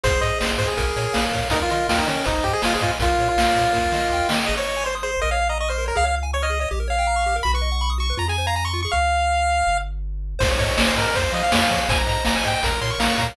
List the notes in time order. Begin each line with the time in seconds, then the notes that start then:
0.03 G#1 G#4 C5, kick, closed hi-hat
0.21 G#2 C5 D#5, closed hi-hat
0.39 G#1 C5 D#5, snare
0.58 G#2 C5, kick, closed hi-hat
0.67 G#4
0.77 A#1 A#4, kick, closed hi-hat
0.96 A#2 C#5, closed hi-hat
1.13 A#1 F5, snare
1.32 A#2 C#5, kick, open hi-hat
1.50 D#2 D#4 A#4, kick, closed hi-hat
1.62 F4
1.69 D#3 F4 D#5, closed hi-hat
1.89 D#2 F4 G5, snare
1.99 D#4
2.07 D#3 C#4 D#5, closed hi-hat
2.17 C#4
2.24 G#1 D#4 C5, kick, closed hi-hat
2.43 G#2 G4 D#5, kick, closed hi-hat
2.53 G#4
2.62 G#1 F4 G#5, snare
2.73 G#4
2.81 G#2 F4 D#5, kick, closed hi-hat
2.99 A#1 F4 A#4, kick, closed hi-hat
3.18 A#2 C#5, closed hi-hat
3.29 F4
3.37 A#1 F5, snare
3.55 A#2 C#5, kick, closed hi-hat
3.72 D#2 A#4, kick, snare
3.92 D#3 D#5, snare
4.10 D#2 G5
4.29 D#3 D#5, snare
4.46 G#1 G#4 D#5
4.57 C5 C#5
4.67 D#5
4.76 G#5
4.84 C5 C6
4.95 D#6
5.03 G#4 C5
5.14 C5
5.22 A#1 A#4 D#5
5.31 C#5 F5
5.41 F5
5.49 D#5 A#5
5.60 D#5 C#6
5.68 C5 F6
5.78 A#4
5.86 A#4 C#5
5.95 C#2 G#4 F5
6.04 C#5 F5
6.16 F5
6.23 G#5
6.33 C#5 C#6
6.42 D#5 F6
6.50 G#4
6.60 C#5 D#5
6.71 A#1 G4
6.80 A#4
6.88 C#5 F5
6.98 G5
7.07 A#5
7.16 C#6
7.26 G4
7.36 A#4
7.43 B1 F#4 B5
7.54 B4 C#6
7.61 D#5
7.72 F#5
7.81 B5 C#6
7.90 D#6
7.98 F#4 C#6
8.10 B4
8.17 F2 F4 A#5
8.28 G#4 G#5
8.38 C5
8.47 F5 A#5
8.56 G#5 A#5
8.65 C6 C#6
8.73 F4
8.82 G#4 C#6
8.92 C#2 F5
9.67 G1
10.39 G#1 C5, kick, crash
10.50 C#5
10.58 G#2 C#5 D#5, kick, closed hi-hat
10.77 G#1 C#5 G#5, snare
10.86 C5
10.96 G#2 A#4 D#5, closed hi-hat
11.07 A#4
11.14 F2 C5, kick, closed hi-hat
11.31 F3 D#5 F5, closed hi-hat
11.43 F5
11.52 F2 C#5 G#5, snare
11.61 F5
11.70 F3 C#5 F5, kick, closed hi-hat
11.89 G#1 C5 G#5, kick, closed hi-hat
11.98 A#5
12.06 G#2 D#5 A#5, closed hi-hat
12.25 G#1 G#5 A#5, snare
12.36 G#5
12.44 G#2 D#5 G5, closed hi-hat
12.55 G5
12.63 A#1 A#4 A#5, kick, closed hi-hat
12.81 A#2 C#5 C6, closed hi-hat
12.90 C#6
12.99 A#1 F5 A#5, snare
13.09 C#6
13.18 A#2 C#5 A#5, kick, closed hi-hat